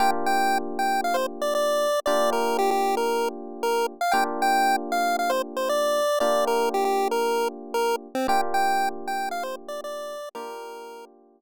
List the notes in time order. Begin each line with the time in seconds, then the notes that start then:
0.00 A#3 D4 F4 G4 G5
0.26 G5
0.79 G5
1.04 F5
1.14 C5
1.42 D5
1.55 D5
2.06 A#3 D4 F4 G4 D5
2.33 A#4
2.59 G4
2.71 G4
2.97 A#4
3.63 A#4
4.01 F5
4.12 A#3 D4 F4 G4 G5
4.42 G5
4.92 F5
5.19 F5
5.30 C5
5.57 C5
5.69 D5
6.20 A#3 D4 F4 G4 D5
6.47 A#4
6.74 G4
6.85 G4
7.11 A#4
7.74 A#4
8.15 C4
8.28 A#3 D4 F4 G4 G5
8.54 G5
9.08 G5
9.31 F5
9.43 C5
9.68 D5
9.84 D5
10.35 A#3 D4 F4 G4 A#4